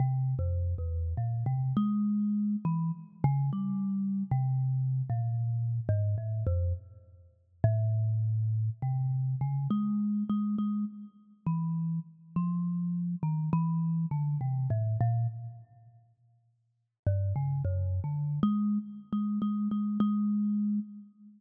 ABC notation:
X:1
M:3/4
L:1/16
Q:1/4=51
K:none
V:1 name="Kalimba" clef=bass
(3C,2 F,,2 E,,2 ^A,, C, ^G,3 E, z ^C, | (3G,4 C,4 ^A,,4 ^G,, =A,, F,, z | z2 A,,4 C,2 ^C, ^G,2 G, | ^G, z2 E,2 z F,3 ^D, E,2 |
D, C, A,, ^A,, z6 G,, ^C, | (3^F,,2 D,2 ^G,2 z G, G, G, G,3 z |]